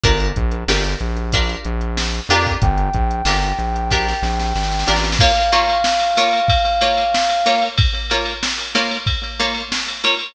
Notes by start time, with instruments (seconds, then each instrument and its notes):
0.03 synth bass 1 G1, pizzicato strings D4 F4 G4 A#4, kick, closed hi-hat
0.20 closed hi-hat
0.36 synth bass 1 A#1, kick, closed hi-hat
0.51 closed hi-hat
0.68 synth bass 1 G1, pizzicato strings D4 F4 G4 A#4, snare
0.84 closed hi-hat
1.00 synth bass 1 A#1, closed hi-hat
1.17 closed hi-hat
1.32 pizzicato strings D4 F4 G4 A#4, kick, closed hi-hat
1.49 closed hi-hat
1.65 synth bass 1 A#1, closed hi-hat
1.81 closed hi-hat
1.97 snare
2.14 closed hi-hat
2.29 synth bass 1 F2, pizzicato strings D4 F4 G4 A#4, closed hi-hat
2.47 kick, snare, closed hi-hat
2.62 synth bass 1 G1, brass section G5, kick, closed hi-hat
2.78 closed hi-hat
2.94 synth bass 1 A#1, kick, closed hi-hat
3.11 closed hi-hat
3.25 synth bass 1 G1, pizzicato strings D4 F4 G4 A#4, snare
3.43 closed hi-hat
3.59 synth bass 1 A#1, closed hi-hat
3.76 closed hi-hat
3.90 pizzicato strings D4 F4 G4 A#4, kick, snare
4.08 snare
4.22 synth bass 1 A#1, snare
4.40 snare
4.55 synth bass 1 G#1, snare
4.63 snare
4.72 snare
4.79 snare
4.87 synth bass 1 A1, pizzicato strings D4 F4 G4 A#4, snare
4.96 snare
5.03 snare
5.12 snare
5.19 pizzicato strings A#3 F4 C#5, brass section F5, kick, crash
5.35 ride
5.52 pizzicato strings A#3 F4 C#5, ride
5.69 ride
5.84 snare
6.00 snare, ride
6.16 pizzicato strings A#3 F4 C#5, snare, ride
6.33 ride
6.48 kick, ride
6.65 ride
6.81 pizzicato strings A#3 F4 C#5, ride
6.97 ride
7.15 snare
7.29 ride
7.45 pizzicato strings A#3 F4 C#5, snare, ride
7.62 ride
7.78 kick, ride
7.94 ride
8.10 pizzicato strings A#3 F4 C#5, ride
8.25 ride
8.43 snare
8.59 snare, ride
8.75 pizzicato strings A#3 F4 C#5, snare, ride
8.91 ride
9.06 kick, ride
9.23 ride
9.40 pizzicato strings A#3 F4 C#5, ride
9.54 ride
9.72 snare
9.88 ride
10.04 pizzicato strings A#3 F4 C#5, ride
10.19 ride